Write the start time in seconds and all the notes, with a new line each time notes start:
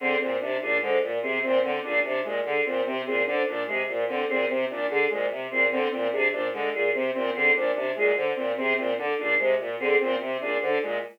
0.00 D3 C4 G#4
0.20 A#2 C4 C5
0.41 C3 D4
0.61 A#2 D4 G#4
0.82 D3 G#3 C5
1.02 A#2
1.22 C3 C4 G#4
1.43 A#2 C4 C5
1.63 D3 C4
1.83 A#2 D4 G#4
2.04 C3 D4 C5
2.24 A#2 G#3
2.45 D3 G#4
2.65 A#2 C4 C5
2.85 C3 C4
3.06 A#2 C4 G#4
3.26 D3 D4 C5
3.47 A#2 D4
3.67 C3 G#3 G#4
3.88 A#2 C5
4.08 D3 C4
4.29 A#2 C4 G#4
4.49 C3 C4 C5
4.69 A#2 D4
4.89 D3 D4 G#4
5.10 A#2 G#3 C5
5.31 C3
5.51 A#2 C4 G#4
5.71 D3 C4 C5
5.92 A#2 C4
6.12 C3 D4 G#4
6.32 A#2 D4 C5
6.53 D3 G#3
6.73 A#2 G#4
6.94 C3 C4 C5
7.14 A#2 C4
7.35 D3 C4 G#4
7.55 A#2 D4 C5
7.75 C3 D4
7.96 A#2 G#3 G#4
8.16 D3 C5
8.36 A#2 C4
8.57 C3 C4 G#4
8.77 A#2 C4 C5
8.98 D3 D4
9.18 A#2 D4 G#4
9.39 C3 G#3 C5
9.59 A#2
9.80 D3 C4 G#4
10.00 A#2 C4 C5
10.20 C3 C4
10.41 A#2 D4 G#4
10.61 D3 D4 C5
10.82 A#2 G#3